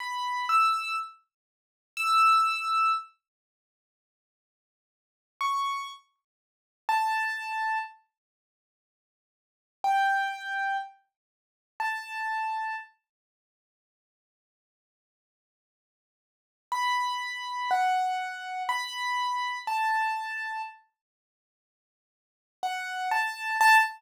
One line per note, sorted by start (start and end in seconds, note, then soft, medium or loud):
0.00 0.45 B5 soft
0.49 0.96 E6 medium
1.97 2.92 E6 medium
5.41 5.88 C#6 soft
6.89 7.78 A5 medium
9.84 10.77 G5 medium
11.80 12.76 A5 medium
16.72 17.70 B5 medium
17.71 18.63 F#5 medium
18.69 19.59 B5 medium
19.67 20.62 A5 medium
22.63 23.09 F#5 medium
23.11 23.57 A5 medium
23.61 23.78 A5 loud